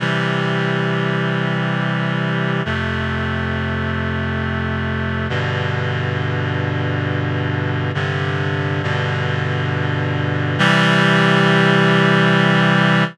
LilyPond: \new Staff { \time 3/4 \key c \major \tempo 4 = 68 <c e g>2. | <f, c a>2. | <g, b, d>2. | <g, c d>4 <g, b, d>2 |
<c e g>2. | }